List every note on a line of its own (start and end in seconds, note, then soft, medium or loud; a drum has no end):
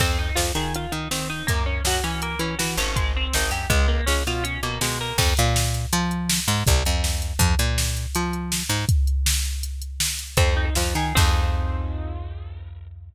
0.00 0.31 F2 medium
0.00 0.17 C4 medium
0.00 kick loud
0.00 crash loud
0.19 0.35 D#4 medium
0.35 0.52 F2 medium
0.35 0.52 F4 medium
0.35 snare loud
0.55 0.86 D#3 medium
0.55 0.73 G#4 medium
0.75 0.92 F4 medium
0.75 closed hi-hat loud
0.92 1.08 D#3 medium
0.92 1.09 D#4 medium
1.11 1.43 D#3 medium
1.11 1.28 C4 medium
1.11 snare loud
1.30 1.46 D#4 medium
1.47 1.81 F#2 medium
1.47 1.64 A#3 medium
1.47 kick loud
1.47 closed hi-hat loud
1.66 1.83 C#4 medium
1.85 2.00 F#2 medium
1.85 2.03 F#4 medium
1.85 snare loud
2.04 2.35 E3 medium
2.04 2.20 C#4 medium
2.22 2.39 A#3 medium
2.22 closed hi-hat loud
2.39 2.55 E3 medium
2.39 2.57 C#4 medium
2.59 2.77 E3 medium
2.59 2.75 F#4 medium
2.59 snare loud
2.77 3.27 G#1 medium
2.77 2.95 C#4 medium
2.96 3.13 G#3 medium
2.96 kick loud
2.96 closed hi-hat loud
3.16 3.33 C4 medium
3.33 3.51 G#1 medium
3.33 3.51 D#4 medium
3.33 snare loud
3.51 3.67 F#2 medium
3.51 3.68 G4 medium
3.70 4.01 C#2 medium
3.70 3.86 G#3 medium
3.70 kick loud
3.70 closed hi-hat loud
3.88 4.05 A#3 medium
4.06 4.24 C#2 medium
4.06 4.23 C#4 medium
4.06 snare loud
4.27 4.58 B2 medium
4.27 4.44 F4 medium
4.44 4.60 C#4 medium
4.44 closed hi-hat loud
4.63 4.79 B2 medium
4.63 4.80 A#3 medium
4.81 5.12 B2 medium
4.81 4.98 G#3 medium
4.81 snare loud
5.01 5.17 A#3 medium
5.18 5.34 F2 loud
5.18 kick loud
5.18 crash loud
5.37 5.86 A#2 loud
5.37 closed hi-hat medium
5.56 snare loud
5.74 closed hi-hat medium
5.93 6.40 F3 loud
5.93 closed hi-hat loud
6.11 closed hi-hat medium
6.29 snare loud
6.48 6.63 G#2 loud
6.48 closed hi-hat medium
6.67 6.83 C2 loud
6.67 kick loud
6.67 closed hi-hat loud
6.85 7.33 F2 medium
6.85 closed hi-hat medium
7.04 snare loud
7.22 closed hi-hat medium
7.39 7.55 F2 loud
7.39 kick loud
7.39 closed hi-hat loud
7.59 8.06 A#2 medium
7.59 closed hi-hat medium
7.78 snare loud
7.97 closed hi-hat medium
8.15 8.63 F3 medium
8.15 closed hi-hat loud
8.33 closed hi-hat medium
8.52 snare loud
8.69 8.85 G#2 loud
8.69 closed hi-hat medium
8.89 kick loud
8.89 closed hi-hat loud
9.07 closed hi-hat medium
9.26 snare loud
9.45 closed hi-hat medium
9.63 closed hi-hat loud
9.82 closed hi-hat medium
10.00 snare loud
10.19 closed hi-hat medium
10.37 10.70 F2 medium
10.37 10.54 C4 medium
10.37 kick loud
10.37 closed hi-hat loud
10.57 10.74 D#4 medium
10.75 10.94 F2 medium
10.75 10.94 F4 medium
10.75 snare loud
10.95 11.13 D#3 medium
10.95 11.15 G#4 medium
11.15 13.10 F2 loud
11.15 13.08 C4 loud
11.15 13.08 D#4 loud
11.15 13.08 F4 medium
11.15 13.08 G#4 medium
11.15 kick loud
11.15 crash loud